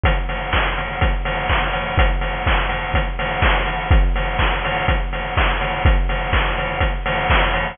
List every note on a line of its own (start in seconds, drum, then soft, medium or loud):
0.04 kick loud
0.04 closed hi-hat loud
0.29 open hi-hat medium
0.53 kick loud
0.53 clap loud
0.78 open hi-hat medium
1.01 kick loud
1.01 closed hi-hat loud
1.25 open hi-hat loud
1.49 kick loud
1.49 clap loud
1.73 open hi-hat medium
1.98 kick loud
1.98 closed hi-hat loud
2.21 open hi-hat medium
2.46 kick loud
2.46 clap loud
2.69 open hi-hat medium
2.94 kick loud
2.94 closed hi-hat loud
3.19 open hi-hat loud
3.42 kick loud
3.42 clap loud
3.66 open hi-hat medium
3.91 kick loud
3.91 closed hi-hat loud
4.16 open hi-hat loud
4.39 kick loud
4.39 clap loud
4.65 open hi-hat loud
4.88 kick loud
4.88 closed hi-hat loud
5.13 open hi-hat medium
5.37 kick loud
5.37 clap loud
5.61 open hi-hat loud
5.85 kick loud
5.85 closed hi-hat loud
6.09 open hi-hat loud
6.33 kick loud
6.33 clap loud
6.58 open hi-hat loud
6.80 kick loud
6.80 closed hi-hat loud
7.06 open hi-hat loud
7.30 kick loud
7.30 clap loud
7.54 open hi-hat loud